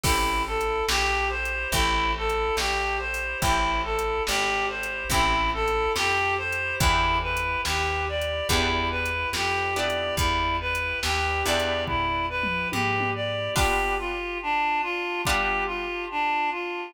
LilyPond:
<<
  \new Staff \with { instrumentName = "Clarinet" } { \time 4/4 \key e \minor \tempo 4 = 71 e'8 a'8 g'8 c''8 e'8 a'8 g'8 c''8 | e'8 a'8 g'8 c''8 e'8 a'8 g'8 c''8 | e'8 b'8 g'8 d''8 e'8 b'8 g'8 d''8 | e'8 b'8 g'8 d''8 e'8 b'8 g'8 d''8 |
\key b \minor g'8 f'8 d'8 f'8 g'8 f'8 d'8 f'8 | }
  \new Staff \with { instrumentName = "Acoustic Guitar (steel)" } { \time 4/4 \key e \minor <c' e' g' a'>2 <c' e' g' a'>2 | <c' e' g' a'>2 <c' e' g' a'>2 | <b d' e' g'>2 <b d' e' g'>4. <b d' e' g'>8~ | <b d' e' g'>4. <b d' e' g'>2~ <b d' e' g'>8 |
\key b \minor <g b d' f'>2 <g b d' f'>2 | }
  \new Staff \with { instrumentName = "Electric Bass (finger)" } { \clef bass \time 4/4 \key e \minor a,,4 ais,,4 a,,4 ais,,4 | a,,4 gis,,4 a,,4 f,4 | e,4 dis,4 e,4 f,4 | e,4 dis,8 e,4. gis,4 |
\key b \minor r1 | }
  \new DrumStaff \with { instrumentName = "Drums" } \drummode { \time 4/4 \tuplet 3/2 { <cymc bd>8 r8 hh8 sn8 r8 hh8 <hh bd>8 r8 hh8 sn8 r8 hho8 } | \tuplet 3/2 { <hh bd>8 r8 hh8 sn8 r8 hh8 <hh bd>8 r8 hh8 sn8 r8 hh8 } | \tuplet 3/2 { <hh bd>8 r8 hh8 sn8 r8 hh8 <hh bd>8 r8 hh8 sn8 r8 hh8 } | \tuplet 3/2 { <hh bd>8 r8 hh8 sn8 r8 hh8 <bd tomfh>8 r8 toml8 tommh8 tommh8 r8 } |
<cymc bd>4 r4 bd4 r4 | }
>>